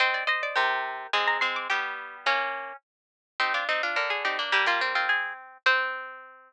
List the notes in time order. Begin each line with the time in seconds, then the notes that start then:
0.00 C4 C5 D#5
0.14 D5
0.27 C5 D#5
0.43 D5
0.56 C3 G4 A#4 C5
1.13 G#3 C4 G#5
1.27 A#5
1.41 G#3 C4 C6
1.56 D6
1.70 G3 B3 G4 G5
2.26 A#3 C#4 F5
3.40 C4 D#4 G4
3.54 D4 F4 D5
3.69 C4 D#4
3.83 D4 F4
3.96 D3 A#4
4.10 G#4
4.25 C4 D#4 G4
4.39 A#3 D4
4.52 G3 A#3 G4
4.66 G3 A#3 F4
4.81 C4
4.95 C4 F4
5.09 G#4
5.66 C4 C5